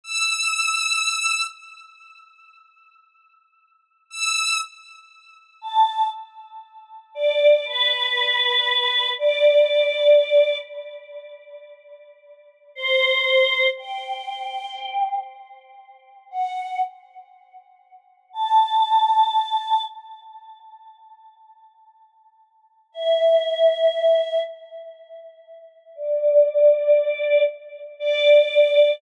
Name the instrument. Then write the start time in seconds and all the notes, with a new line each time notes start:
choir aahs
0.04 E6
4.10 E6
5.61 A5
7.15 D5
7.66 B4
9.18 D5
12.75 C5
13.77 G5
16.31 F#5
18.33 A5
22.92 E5
25.95 D5
27.99 D5